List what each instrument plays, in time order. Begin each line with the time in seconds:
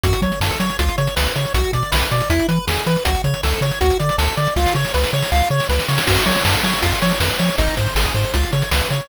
0.04 synth bass 1 F#2, lead 1 (square) F#4, kick, closed hi-hat
0.13 closed hi-hat
0.22 synth bass 1 F#3, lead 1 (square) C#5, kick, closed hi-hat
0.32 closed hi-hat
0.41 synth bass 1 F#2, lead 1 (square) A4, snare
0.51 kick, closed hi-hat
0.60 synth bass 1 F#3, lead 1 (square) C#5, closed hi-hat
0.70 closed hi-hat
0.79 synth bass 1 C#2, lead 1 (square) F4, kick, closed hi-hat
0.89 closed hi-hat
0.98 synth bass 1 C#3, lead 1 (square) C#5, closed hi-hat
1.07 closed hi-hat
1.16 synth bass 1 C#2, lead 1 (square) B4, snare
1.26 closed hi-hat
1.36 synth bass 1 C#3, lead 1 (square) C#5, closed hi-hat
1.45 closed hi-hat
1.54 synth bass 1 B1, lead 1 (square) F#4, kick, closed hi-hat
1.64 closed hi-hat
1.73 synth bass 1 B2, lead 1 (square) D5, kick, closed hi-hat
1.83 closed hi-hat
1.92 synth bass 1 B1, lead 1 (square) B4, snare
2.02 kick, closed hi-hat
2.11 synth bass 1 B2, lead 1 (square) D5, closed hi-hat
2.21 closed hi-hat
2.30 synth bass 1 E2, lead 1 (square) E4, kick, closed hi-hat
2.39 closed hi-hat
2.48 synth bass 1 E3, lead 1 (square) B4, closed hi-hat
2.67 synth bass 1 E2, lead 1 (square) G#4, snare
2.77 closed hi-hat
2.86 synth bass 1 E3, lead 1 (square) B4, closed hi-hat
2.96 closed hi-hat
3.05 synth bass 1 C#2, lead 1 (square) F#4, kick, closed hi-hat
3.15 closed hi-hat
3.24 synth bass 1 C#3, lead 1 (square) C#5, kick, closed hi-hat
3.34 closed hi-hat
3.43 synth bass 1 C#2, lead 1 (square) A4, snare
3.53 kick, closed hi-hat
3.61 synth bass 1 C#3, lead 1 (square) C#5, closed hi-hat
3.71 closed hi-hat
3.81 synth bass 1 D2, lead 1 (square) F#4, kick, closed hi-hat
3.90 closed hi-hat
3.99 synth bass 1 D3, lead 1 (square) D5, closed hi-hat
4.09 closed hi-hat
4.18 synth bass 1 D2, lead 1 (square) A4, snare
4.28 closed hi-hat
4.37 synth bass 1 D3, lead 1 (square) D5, closed hi-hat
4.47 closed hi-hat
4.56 synth bass 1 C#2, lead 1 (square) F4, kick, snare
4.66 snare
4.75 synth bass 1 C#3, lead 1 (square) C#5
4.85 snare
4.94 synth bass 1 C#2, lead 1 (square) B4, snare
5.04 snare
5.13 synth bass 1 C#3, lead 1 (square) C#5
5.22 snare
5.32 synth bass 1 C#2, lead 1 (square) F4, snare
5.50 synth bass 1 C#3, lead 1 (square) C#5
5.60 snare
5.69 synth bass 1 C#2, lead 1 (square) B4, snare
5.79 snare
5.88 synth bass 1 C#3, lead 1 (square) C#5, snare
5.98 snare
6.07 synth bass 1 F#2, lead 1 (square) F#4, kick, crash
6.17 closed hi-hat
6.26 synth bass 1 F#3, lead 1 (square) C#5, kick, closed hi-hat
6.36 closed hi-hat
6.45 synth bass 1 F#2, lead 1 (square) A4, snare
6.54 kick, closed hi-hat
6.63 synth bass 1 F#3, lead 1 (square) C#5, closed hi-hat
6.73 closed hi-hat
6.82 synth bass 1 F2, lead 1 (square) F4, kick, closed hi-hat
6.92 closed hi-hat
7.02 synth bass 1 F3, lead 1 (square) C#5, closed hi-hat
7.11 closed hi-hat
7.20 synth bass 1 F2, lead 1 (square) B4, snare
7.30 closed hi-hat
7.39 synth bass 1 F3, lead 1 (square) C#5, closed hi-hat
7.49 closed hi-hat
7.58 synth bass 1 G#1, lead 1 (square) D#4, kick, closed hi-hat
7.68 closed hi-hat
7.77 synth bass 1 G#2, lead 1 (square) C5, kick, closed hi-hat
7.87 closed hi-hat
7.95 synth bass 1 G#1, lead 1 (square) G#4, snare
8.05 kick, closed hi-hat
8.14 synth bass 1 G#2, lead 1 (square) C5, closed hi-hat
8.24 closed hi-hat
8.34 synth bass 1 C#2, lead 1 (square) F4, kick, closed hi-hat
8.43 closed hi-hat
8.53 synth bass 1 C#3, lead 1 (square) C#5, closed hi-hat
8.62 closed hi-hat
8.71 synth bass 1 C#2, lead 1 (square) B4, snare
8.81 closed hi-hat
8.90 synth bass 1 C#3, lead 1 (square) C#5, closed hi-hat
9.00 closed hi-hat